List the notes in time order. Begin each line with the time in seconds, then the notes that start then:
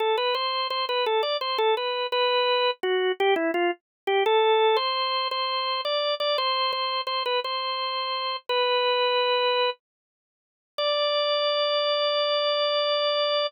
0.00 A4
0.17 B4
0.35 C5
0.70 C5
0.89 B4
1.06 A4
1.23 D5
1.41 C5
1.58 A4
1.77 B4
2.12 B4
2.83 F#4
3.20 G4
3.36 E4
3.54 F4
4.07 G4
4.26 A4
4.77 C5
5.31 C5
5.85 D5
6.20 D5
6.38 C5
6.73 C5
7.07 C5
7.26 B4
7.44 C5
8.49 B4
10.78 D5